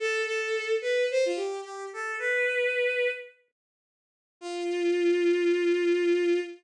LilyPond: \new Staff { \time 4/4 \key f \lydian \tempo 4 = 109 a'8 a'4 b'8 c''16 f'16 g'8 g'8 a'8 | b'2 r2 | f'1 | }